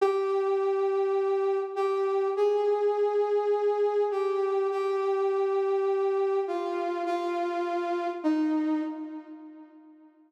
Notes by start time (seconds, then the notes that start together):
0.01 G4
1.76 G4
2.37 G#4
4.11 G4
4.71 G4
6.47 F4
7.06 F4
8.24 D#4